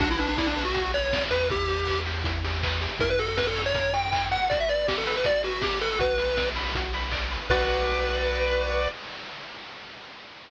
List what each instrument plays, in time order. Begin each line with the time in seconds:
0.00 synth bass 1 B1, lead 1 (square) D4 F#4, kick, crash
0.10 lead 1 (square) E4
0.18 lead 1 (square) D4 B4, open hi-hat
0.28 lead 1 (square) D4
0.38 lead 1 (square) E4 D5, kick, snare
0.46 lead 1 (square) D4
0.56 lead 1 (square) B4, open hi-hat
0.64 lead 1 (square) F#4
0.74 lead 1 (square) F#4, kick, closed hi-hat
0.93 lead 1 (square) B4 C#5, open hi-hat
1.13 lead 1 (square) D5, kick, snare
1.30 synth bass 1 E2, lead 1 (square) B4, open hi-hat
1.50 lead 1 (square) E4 G4, kick, closed hi-hat
1.68 lead 1 (square) G4, open hi-hat
1.87 lead 1 (square) B4, kick, clap
2.05 lead 1 (square) G4, open hi-hat
2.24 lead 1 (square) E4, kick, closed hi-hat
2.44 lead 1 (square) G4, open hi-hat
2.63 lead 1 (square) B4, kick, clap
2.81 lead 1 (square) G4, open hi-hat
2.99 synth bass 1 F#2, lead 1 (square) E4 A#4, kick, closed hi-hat
3.10 lead 1 (square) B4
3.19 lead 1 (square) F#4 A4, open hi-hat
3.28 lead 1 (square) A4
3.37 lead 1 (square) A#4 B4, kick, snare
3.46 lead 1 (square) A4
3.56 lead 1 (square) C#5, open hi-hat
3.65 lead 1 (square) C#5
3.74 lead 1 (square) A#4, kick, closed hi-hat
3.93 lead 1 (square) F#4 G5, open hi-hat
4.12 lead 1 (square) E4, kick, clap
4.31 lead 1 (square) F#4 F#5, open hi-hat
4.49 lead 1 (square) F#4 D5, kick, closed hi-hat
4.60 lead 1 (square) E5
4.68 lead 1 (square) B4 D5, open hi-hat
4.87 lead 1 (square) G4 D5, kick, snare
4.97 lead 1 (square) A4
5.06 lead 1 (square) B4, open hi-hat
5.16 lead 1 (square) B4
5.24 lead 1 (square) F#4 D5, kick, closed hi-hat
5.43 lead 1 (square) F#4 B4, open hi-hat
5.62 lead 1 (square) G4 D5, kick, snare
5.81 lead 1 (square) A4 B4, open hi-hat
5.99 synth bass 1 B1, lead 1 (square) F#4 B4, kick, closed hi-hat
6.18 lead 1 (square) B4, open hi-hat
6.37 lead 1 (square) D5, kick, snare
6.55 lead 1 (square) B4, open hi-hat
6.75 lead 1 (square) F#4, kick, closed hi-hat
6.93 lead 1 (square) B4, open hi-hat
7.11 lead 1 (square) D5, kick, clap
7.31 lead 1 (square) B4, open hi-hat
7.49 synth bass 1 B1, lead 1 (square) F#4 B4 D5, kick, crash